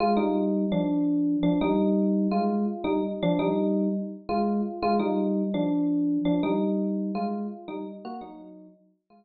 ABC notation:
X:1
M:9/8
L:1/8
Q:3/8=112
K:Fdor
V:1 name="Electric Piano 1"
[A,F] [G,E]3 [F,D]4 [F,D] | [G,E]4 [A,F]2 z [G,E] z | [F,D] [G,E]3 z2 [A,F]2 z | [A,F] [G,E]3 [F,D]4 [F,D] |
[G,E]4 [A,F]2 z [G,E] z | [B,_G] [_G,E]3 z2 [A,F]3 |]